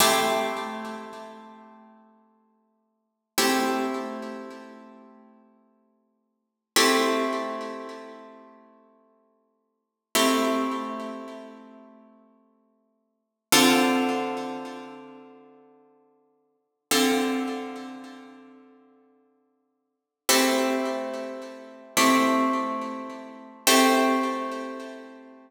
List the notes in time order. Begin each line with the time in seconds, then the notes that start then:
0.00 A3 C4 E4 G4
3.38 A3 C4 E4 G4
6.76 A3 C4 E4 G4
10.15 A3 C4 E4 G4
13.52 D3 C4 F4 A4
16.91 D3 C4 F4 A4
20.29 A3 C4 E4 G4
21.97 A3 C4 E4 G4
23.67 A3 C4 E4 G4